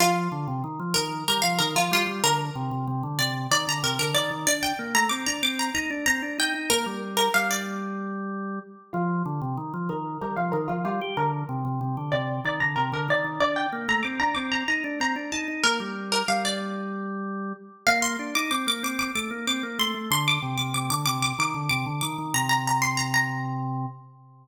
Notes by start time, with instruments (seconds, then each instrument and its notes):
0.00 drawbar organ F3, pizzicato strings F4
0.32 drawbar organ D3
0.48 drawbar organ C3
0.64 drawbar organ D#3
0.80 drawbar organ F3
0.94 drawbar organ D#3, pizzicato strings A#4
1.28 drawbar organ G3, pizzicato strings A#4
1.42 drawbar organ F3, pizzicato strings F5
1.59 drawbar organ D#3, pizzicato strings A#4
1.76 drawbar organ F3, pizzicato strings F4
1.91 drawbar organ G3, pizzicato strings F4
2.07 drawbar organ G3
2.24 drawbar organ D3, pizzicato strings A#4
2.55 drawbar organ C3
2.71 drawbar organ C3
2.88 drawbar organ C3
3.03 drawbar organ D3
3.19 drawbar organ C3, pizzicato strings D5
3.51 drawbar organ D#3, pizzicato strings D5
3.67 drawbar organ D3, pizzicato strings A#5
3.83 drawbar organ C3, pizzicato strings A#4
3.99 drawbar organ D3, pizzicato strings A#4
4.14 drawbar organ D#3, pizzicato strings D5
4.31 drawbar organ D#3
4.47 drawbar organ D4, pizzicato strings D5
4.63 pizzicato strings G5
4.79 drawbar organ A#3
4.95 drawbar organ A3, pizzicato strings A#5
5.09 drawbar organ C4, pizzicato strings D6
5.26 drawbar organ D4, pizzicato strings A#5
5.43 drawbar organ C4, pizzicato strings D6
5.59 pizzicato strings A#5
5.74 drawbar organ D#4, pizzicato strings A#5
5.90 drawbar organ D4
6.06 drawbar organ C4, pizzicato strings A#5
6.22 drawbar organ D4
6.38 drawbar organ D#4, pizzicato strings G5
6.54 drawbar organ D#4
6.70 drawbar organ A#3, pizzicato strings A#4
6.86 drawbar organ G3
7.17 pizzicato strings A#4
7.34 drawbar organ G3, pizzicato strings F5
7.51 pizzicato strings D5
8.93 drawbar organ F3, pizzicato strings F4
9.26 drawbar organ D3
9.41 drawbar organ C3
9.57 drawbar organ D#3
9.74 drawbar organ F3
9.89 drawbar organ D#3, pizzicato strings A#4
10.21 drawbar organ G3, pizzicato strings A#4
10.36 drawbar organ F3, pizzicato strings F5
10.52 drawbar organ D#3, pizzicato strings A#4
10.68 drawbar organ F3, pizzicato strings F4
10.85 drawbar organ G3, pizzicato strings F4
11.01 drawbar organ G4
11.17 drawbar organ D3, pizzicato strings A#4
11.49 drawbar organ C3
11.65 drawbar organ C3
11.81 drawbar organ C3
11.97 drawbar organ D3
12.12 drawbar organ C3, pizzicato strings D5
12.45 drawbar organ D#3, pizzicato strings D5
12.60 drawbar organ D3, pizzicato strings A#5
12.76 drawbar organ C3, pizzicato strings A#4
12.92 drawbar organ D3, pizzicato strings A#4
13.08 drawbar organ D#3, pizzicato strings D5
13.24 drawbar organ D#3
13.40 drawbar organ D4, pizzicato strings D5
13.56 pizzicato strings G5
13.72 drawbar organ A#3
13.88 drawbar organ A3, pizzicato strings A#5
14.03 drawbar organ C4, pizzicato strings D6
14.20 drawbar organ D4, pizzicato strings A#5
14.35 drawbar organ C4, pizzicato strings D6
14.52 pizzicato strings A#5
14.68 drawbar organ D#4, pizzicato strings A#5
14.84 drawbar organ D4
15.00 drawbar organ C4, pizzicato strings A#5
15.16 drawbar organ D4
15.32 drawbar organ D#4, pizzicato strings A5
15.48 drawbar organ D#4
15.64 drawbar organ A#3, pizzicato strings A#4
15.80 drawbar organ G3
16.12 pizzicato strings A#4
16.28 drawbar organ G3, pizzicato strings F5
16.45 pizzicato strings D5
17.87 drawbar organ A#3, pizzicato strings F5
18.02 pizzicato strings C6
18.19 drawbar organ D4
18.35 drawbar organ D#4, pizzicato strings D6
18.51 drawbar organ C4, pizzicato strings D6
18.67 drawbar organ A#3, pizzicato strings D6
18.83 drawbar organ C4, pizzicato strings D6
18.99 pizzicato strings D6
19.15 drawbar organ A3, pizzicato strings D6
19.31 drawbar organ A#3
19.47 drawbar organ C4, pizzicato strings D6
19.63 drawbar organ A#3
19.79 drawbar organ A3, pizzicato strings C6
19.94 drawbar organ A3
20.11 drawbar organ D3, pizzicato strings C6
20.28 pizzicato strings D6
20.42 drawbar organ C3
20.58 drawbar organ C3, pizzicato strings D6
20.74 drawbar organ C3, pizzicato strings D6
20.90 drawbar organ D3, pizzicato strings D6
21.06 drawbar organ C3, pizzicato strings D6
21.22 pizzicato strings D6
21.38 drawbar organ D#3, pizzicato strings D6
21.55 drawbar organ D3
21.69 drawbar organ C3, pizzicato strings D6
21.86 drawbar organ D3
22.01 drawbar organ D#3, pizzicato strings D6
22.18 drawbar organ D#3
22.34 drawbar organ C3, pizzicato strings A#5
22.49 pizzicato strings A#5
22.67 pizzicato strings A#5
22.82 pizzicato strings C6
22.97 pizzicato strings A#5
23.14 pizzicato strings A#5